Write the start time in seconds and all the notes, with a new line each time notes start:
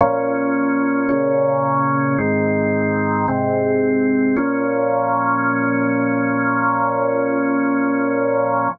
0.01 A#2 F3 C#4
1.09 A#2 C#3 C#4
2.18 G#2 D#3 C4
3.28 G#2 C3 C4
4.36 A#2 F3 C#4